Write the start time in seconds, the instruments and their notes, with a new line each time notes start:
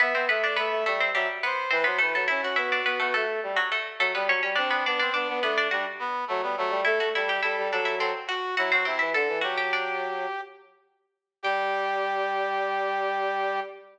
0.00 harpsichord B3 B4, brass section B3 E5
0.14 brass section B3, harpsichord C4 C5
0.28 brass section A3 E5, harpsichord B3 B4
0.43 harpsichord D4 D5, brass section D5
0.56 brass section A3 E5, harpsichord B3 B4
0.70 brass section A3
0.85 brass section G3 E5, harpsichord A3 A4
1.00 harpsichord C4 C5
1.14 brass section F#3 E5, harpsichord G3 G4
1.43 harpsichord B3 B4, brass section C5
1.70 brass section E3 B4, harpsichord C4 C5
1.84 brass section F#3 C5, harpsichord B3 B4
1.98 brass section E3 B4, harpsichord A3 A4
2.15 brass section F#3, harpsichord A3 A4
2.27 brass section C#4 E4, harpsichord E4 E5
2.42 brass section C#4 F#4, harpsichord F#4 F#5
2.56 brass section B3, harpsichord E4 E5
2.72 harpsichord D4 D5
2.85 brass section B3, harpsichord B3 B4
3.00 harpsichord A3 A4, brass section B3
3.14 harpsichord A3 A4, brass section A3
3.43 brass section G3
3.56 harpsichord F#3 F#4
3.72 harpsichord A3 A4
3.99 brass section F#3, harpsichord A3 A4
4.15 brass section G3, harpsichord B3 B4
4.28 brass section F#3, harpsichord C#4 C#5
4.43 brass section G3, harpsichord C#4 C#5
4.55 brass section C4 D4, harpsichord D4 D5
4.71 harpsichord B3 B4, brass section C4
4.86 brass section B3 D4, harpsichord D4 D5
4.99 brass section C4, harpsichord D4 D5
5.13 brass section B3 D4, harpsichord D4 D5
5.29 brass section B3
5.42 brass section A3 D4, harpsichord B3 B4
5.58 harpsichord D4 D5
5.71 brass section G3 D4, harpsichord F#4 F#5
5.99 brass section B3
6.28 brass section F#3 A3
6.42 brass section G3 B3
6.57 brass section F#3 A3
6.70 brass section G3
6.85 brass section A3 A4, harpsichord E4 E5
7.00 brass section A3, harpsichord F#4 F#5
7.15 brass section G3 A4, harpsichord E4 E5
7.27 brass section G4, harpsichord G4 G5
7.42 brass section G3 A4, harpsichord E4 E5
7.58 brass section G3
7.71 brass section F#3 A4, harpsichord D4 D5
7.85 harpsichord E4 E5
7.98 brass section F#3 A4, harpsichord C4 C5
8.27 brass section F#4, harpsichord F#4 F#5
8.57 brass section F#3 E4, harpsichord F#4 F#5
8.71 brass section F#3 F#4, harpsichord C4 C5
8.85 brass section C3 E4, harpsichord C4 C5
8.99 brass section E3, harpsichord E4 E5
9.13 brass section D3 A4, harpsichord A4 A5
9.28 brass section E3
9.41 brass section F#3 G4, harpsichord F#4 F#5
9.58 harpsichord G4 G5
9.73 harpsichord D4 D5
11.43 brass section G3 G4, harpsichord G5